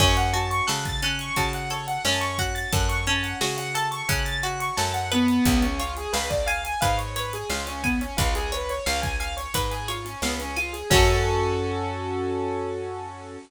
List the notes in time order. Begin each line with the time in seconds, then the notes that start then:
0.00 F#2 C#4 C#5, kick, crash
0.17 F#5, closed hi-hat
0.33 F#4 A5, closed hi-hat
0.51 C#6, closed hi-hat
0.67 C#3 A4 F#6, snare
0.85 A6, kick, closed hi-hat
1.02 C#4 F#6, closed hi-hat
1.19 C#6, closed hi-hat
1.36 C#3 F#4 A5, kick, closed hi-hat
1.53 F#5, closed hi-hat
1.70 A4 C#5, closed hi-hat
1.87 F#5, closed hi-hat
2.05 F#2 C#4 A5, snare
2.21 C#6, closed hi-hat
2.38 F#4 F#6, kick, closed hi-hat
2.55 A6, closed hi-hat
2.72 F#2 A4 F#6, kick, closed hi-hat
2.89 C#6, closed hi-hat
3.07 C#4 A5, closed hi-hat
3.23 F#5, closed hi-hat
3.41 C#3 F#4 C#5, snare
3.57 F#5, closed hi-hat
3.74 A4 A5, closed hi-hat
3.91 C#6, closed hi-hat
4.09 C#3 C#4 F#6, kick, closed hi-hat
4.25 A6, closed hi-hat
4.43 F#4 F#6, closed hi-hat
4.60 C#6, closed hi-hat
4.77 F#2 A4 A5, snare
4.94 F#5, closed hi-hat
5.12 B3 B4, closed hi-hat
5.28 closed hi-hat
5.45 C#2, kick, closed hi-hat
5.62 C#4, closed hi-hat
5.79 F4 C#5, closed hi-hat
5.97 G#4, closed hi-hat
6.13 C#2 B4 F5, snare
6.30 D5, kick, closed hi-hat
6.46 F5 G#5, closed hi-hat
6.64 G#5, closed hi-hat
6.81 G#2 B4 F5, kick, closed hi-hat
6.97 C#5, closed hi-hat
7.16 B4 C#5, closed hi-hat
7.33 G#4, closed hi-hat
7.50 C#2 F4 F5, snare
7.67 C#4, closed hi-hat
7.83 B3 G#5, kick, closed hi-hat
8.01 C#4, closed hi-hat
8.17 C#2 F4 B4, kick, closed hi-hat
8.35 G#4, closed hi-hat
8.52 B4 C#5, closed hi-hat
8.69 C#5, closed hi-hat
8.86 C#2 F5, snare
9.02 G#5, kick, closed hi-hat
9.20 F5 G#5, closed hi-hat
9.37 C#5, closed hi-hat
9.54 G#2 B4, kick, closed hi-hat
9.71 G#4, closed hi-hat
9.88 F4 C#5, closed hi-hat
10.05 C#4, closed hi-hat
10.22 C#2 B3 F5, snare
10.40 C#4, closed hi-hat
10.56 F4 G#5, closed hi-hat
10.73 G#4, closed hi-hat
10.90 F#2 C#4 F#4 A4, kick, crash
10.96 A4